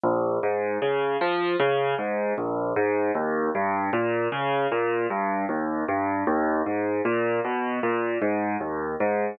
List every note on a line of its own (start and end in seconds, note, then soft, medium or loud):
0.04 0.39 A#1 medium
0.43 0.78 G#2 medium
0.82 1.17 C#3 medium
1.21 1.56 F3 medium
1.60 1.95 C#3 medium
1.98 2.33 G#2 medium
2.38 2.73 A#1 medium
2.76 3.11 G#2 medium
3.15 3.50 D#2 medium
3.55 3.90 G2 medium
3.93 4.28 A#2 medium
4.32 4.67 C#3 medium
4.72 5.07 A#2 medium
5.10 5.45 G2 medium
5.49 5.84 D#2 medium
5.88 6.24 G2 medium
6.27 6.62 D#2 medium
6.66 7.01 G#2 medium
7.05 7.40 A#2 medium
7.44 7.80 B2 medium
7.83 8.18 A#2 medium
8.22 8.57 G#2 medium
8.60 8.95 D#2 medium
9.00 9.35 G#2 medium